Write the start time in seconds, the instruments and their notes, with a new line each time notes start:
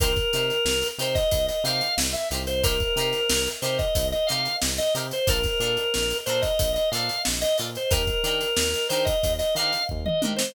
0.00 synth bass 1 C2, acoustic guitar (steel) D#4 G4 A#4 C5, drawbar organ A#4, kick, closed hi-hat
0.16 kick, closed hi-hat
0.33 synth bass 1 C3, acoustic guitar (steel) D#4 G4 A#4 C5, closed hi-hat
0.50 closed hi-hat
0.65 synth bass 1 C2, snare
0.82 closed hi-hat
0.98 synth bass 1 C3, acoustic guitar (steel) D#4 G4 A#4 C5, drawbar organ C5, closed hi-hat
1.15 drawbar organ D#5, kick, snare, closed hi-hat
1.31 synth bass 1 C2, kick, closed hi-hat
1.48 drawbar organ D#5, closed hi-hat
1.64 synth bass 1 C3, acoustic guitar (steel) D#4 G4 A#4 C5, drawbar organ F5, closed hi-hat
1.81 closed hi-hat
1.98 synth bass 1 C2, snare
2.13 drawbar organ E5, closed hi-hat
2.31 synth bass 1 C2, acoustic guitar (steel) D#4 G4 A#4 C5, closed hi-hat
2.47 drawbar organ C5, closed hi-hat
2.63 acoustic guitar (steel) D#4 G4 A#4 C5, drawbar organ A#4, kick, closed hi-hat
2.80 kick, closed hi-hat
2.96 synth bass 1 C3, acoustic guitar (steel) D#4 G4 A#4, closed hi-hat
3.00 acoustic guitar (steel) C5
3.13 snare, closed hi-hat
3.30 synth bass 1 C2, snare
3.46 closed hi-hat
3.62 synth bass 1 C3, acoustic guitar (steel) D#4 G4 A#4 C5, drawbar organ C5, closed hi-hat
3.78 drawbar organ D#5, kick, closed hi-hat
3.95 synth bass 1 C2, kick, closed hi-hat
4.12 drawbar organ D#5, closed hi-hat
4.27 synth bass 1 C3, acoustic guitar (steel) D#4 G4, drawbar organ F5, closed hi-hat
4.31 acoustic guitar (steel) A#4 C5
4.45 closed hi-hat
4.62 synth bass 1 C2, snare
4.78 drawbar organ D#5, closed hi-hat
4.95 synth bass 1 C3, acoustic guitar (steel) D#4 G4 A#4 C5, closed hi-hat
5.11 drawbar organ C5, closed hi-hat
5.27 synth bass 1 A#1, acoustic guitar (steel) D4 F4 A4 A#4, drawbar organ A#4, kick, closed hi-hat
5.43 kick, snare, closed hi-hat
5.60 synth bass 1 A#2, acoustic guitar (steel) D4 F4 A4 A#4, closed hi-hat
5.77 closed hi-hat
5.94 synth bass 1 A#1, snare
6.10 closed hi-hat
6.26 synth bass 1 A#2, acoustic guitar (steel) D4 F4 A4 A#4, drawbar organ C5, closed hi-hat
6.42 drawbar organ D#5, kick, snare, closed hi-hat
6.59 synth bass 1 A#1, kick, closed hi-hat
6.74 drawbar organ D#5, closed hi-hat
6.92 synth bass 1 A#2, acoustic guitar (steel) D4 F4 A4, drawbar organ F5, snare, closed hi-hat
6.96 acoustic guitar (steel) A#4
7.09 closed hi-hat
7.25 synth bass 1 A#1, snare
7.41 drawbar organ D#5, closed hi-hat
7.58 synth bass 1 A#2, acoustic guitar (steel) D4 F4 A4 A#4, closed hi-hat
7.75 drawbar organ C5, closed hi-hat
7.91 synth bass 1 D#2, acoustic guitar (steel) D4 D#4 G4 A#4, drawbar organ A#4, kick, closed hi-hat
8.07 kick, closed hi-hat
8.23 synth bass 1 D#3, acoustic guitar (steel) D4 D#4 G4 A#4, closed hi-hat
8.41 closed hi-hat
8.56 synth bass 1 D#2, snare
8.74 closed hi-hat
8.89 synth bass 1 D#3, acoustic guitar (steel) D4 D#4 G4 A#4, drawbar organ C5, closed hi-hat
9.05 drawbar organ D#5, kick, closed hi-hat
9.23 synth bass 1 D#2, kick, closed hi-hat
9.39 drawbar organ D#5, snare, closed hi-hat
9.55 synth bass 1 D#3, acoustic guitar (steel) D4 D#4 G4, drawbar organ F5, snare, closed hi-hat
9.59 acoustic guitar (steel) A#4
9.73 closed hi-hat
9.89 synth bass 1 D#2, kick
10.06 drawbar organ D#5, mid tom
10.22 synth bass 1 D#3, acoustic guitar (steel) D4 D#4 G4 A#4, high tom
10.36 drawbar organ C5, snare